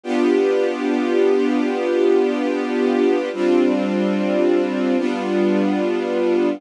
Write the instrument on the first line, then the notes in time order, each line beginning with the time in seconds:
string ensemble 1
0.03 B3 D4 F4 G4
3.33 G3 C4 D4 F4
4.97 G3 B3 D4 F4